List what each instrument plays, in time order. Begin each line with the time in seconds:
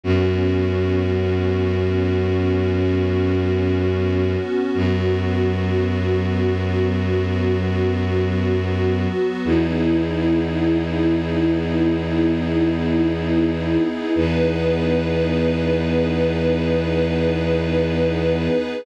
0.03 violin F#2, pad 2 (warm) B3 C#4 F#4
4.74 violin F#2, pad 2 (warm) F#3 B3 F#4
9.45 violin E2, pad 2 (warm) B3 D#4 E4 G#4
14.15 violin E2, pad 2 (warm) B3 D#4 G#4 B4